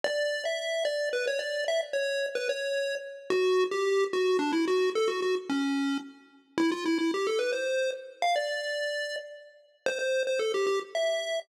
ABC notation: X:1
M:3/4
L:1/16
Q:1/4=110
K:D
V:1 name="Lead 1 (square)"
d3 e3 d2 B c d2 | e z c3 B c4 z2 | F3 G3 F2 D E F2 | A F F z C4 z4 |
[K:C] E F E E G A B c3 z2 | f d7 z4 | c c2 c A G G z e4 |]